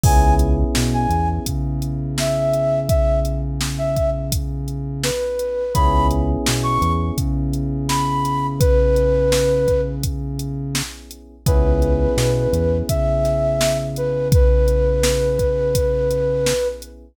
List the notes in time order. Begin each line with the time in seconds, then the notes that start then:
0.04 C#2 B3 C#4 E4 G#4 G#5, kick, crash
0.39 closed hi-hat
0.75 B2, snare
0.93 G#5
1.10 E2, closed hi-hat
1.46 C#3, kick, closed hi-hat
1.82 closed hi-hat
2.18 E5, snare
2.54 closed hi-hat
2.89 E5, kick, closed hi-hat
3.25 closed hi-hat
3.61 snare
3.78 E5
3.97 kick, closed hi-hat
4.32 kick, closed hi-hat
4.68 closed hi-hat
5.03 B4, snare
5.39 closed hi-hat
5.74 C#2 B3 C#4 E4 G#4 B5, kick, closed hi-hat
6.11 closed hi-hat
6.46 B2, snare
6.63 C#6
6.82 E2, closed hi-hat
7.18 C#3, kick, closed hi-hat
7.53 closed hi-hat
7.89 B5, snare
8.25 snare, closed hi-hat
8.60 B4, kick, closed hi-hat
8.96 closed hi-hat
9.32 snare
9.68 kick, closed hi-hat
10.03 kick, closed hi-hat
10.39 closed hi-hat
10.75 snare
11.11 closed hi-hat
11.46 C#2 B3 C#4 E4 G#4 B4, kick, closed hi-hat
11.82 closed hi-hat
12.17 B2, snare
12.53 E2, closed hi-hat
12.89 C#3 E5, kick, closed hi-hat
13.25 snare, closed hi-hat
13.61 snare
13.96 B4, closed hi-hat
14.32 B4, kick, closed hi-hat
14.68 closed hi-hat
15.03 snare
15.39 kick, closed hi-hat
15.75 kick, closed hi-hat
16.11 closed hi-hat
16.46 snare
16.82 closed hi-hat